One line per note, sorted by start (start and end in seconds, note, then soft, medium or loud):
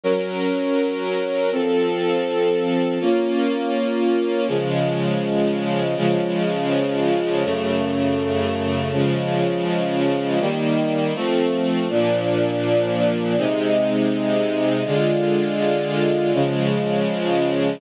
0.04 1.50 F#3 medium
0.04 1.50 C#4 medium
0.04 1.50 A#4 medium
1.52 2.98 F3 medium
1.52 2.98 C4 medium
1.52 2.98 A4 medium
3.00 4.47 A#3 medium
3.00 4.47 C#4 medium
3.00 4.47 F4 medium
4.48 5.95 C#3 medium
4.48 5.95 F3 medium
4.48 5.95 G#3 medium
5.97 7.43 C#3 medium
5.97 7.43 F3 medium
5.97 7.43 G#3 medium
7.44 8.91 F#2 medium
7.44 8.91 C#3 medium
7.44 8.91 A3 medium
8.92 10.39 C#3 medium
8.92 10.39 F3 medium
8.92 10.39 G#3 medium
10.40 11.14 D#3 medium
10.40 11.14 G3 medium
10.40 11.14 A#3 medium
11.15 11.88 F3 medium
11.15 11.88 A3 medium
11.15 11.88 C4 medium
11.89 13.35 A#2 medium
11.89 13.35 F3 medium
11.89 13.35 D4 medium
13.37 14.83 C3 medium
13.37 14.83 G#3 medium
13.37 14.83 D#4 medium
14.85 16.32 D3 medium
14.85 16.32 G#3 medium
14.85 16.32 F4 medium
16.33 17.80 C#3 medium
16.33 17.80 F3 medium
16.33 17.80 G#3 medium